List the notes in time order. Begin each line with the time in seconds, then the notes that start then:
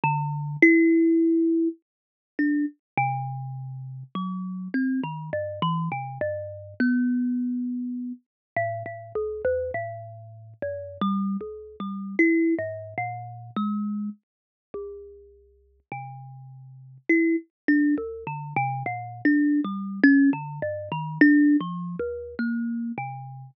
0.04 D3
0.62 E4
2.39 D4
2.97 C3
4.15 F#3
4.74 C4
5.03 D#3
5.33 G2
5.62 E3
5.92 C3
6.21 G2
6.80 B3
8.56 A2
8.86 A2
9.15 C#2
9.45 E2
9.74 A2
10.62 F#2
11.01 G3
11.41 C#2
11.80 G3
12.19 E4
12.59 G#2
12.98 A#2
13.56 G#3
14.74 C2
15.92 C3
17.09 E4
17.68 D4
17.98 D2
18.27 D3
18.56 C3
18.86 A#2
19.25 D4
19.64 G3
20.03 C#4
20.33 D3
20.62 G2
20.92 D#3
21.21 D4
21.61 F3
22.00 D#2
22.39 A#3
22.98 C3